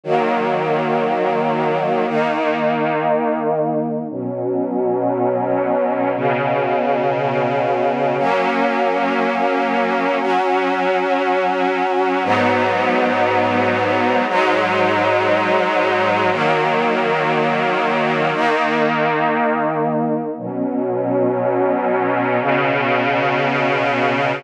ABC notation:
X:1
M:4/4
L:1/8
Q:1/4=59
K:F#mix
V:1 name="String Ensemble 1"
[D,F,A,]4 [D,A,D]4 | [B,,F,C]4 [B,,C,C]4 | [F,A,C]4 [F,CF]4 | [G,,F,B,D]4 [G,,F,G,D]4 |
[D,F,A,]4 [D,A,D]4 | [B,,F,C]4 [B,,C,C]4 |]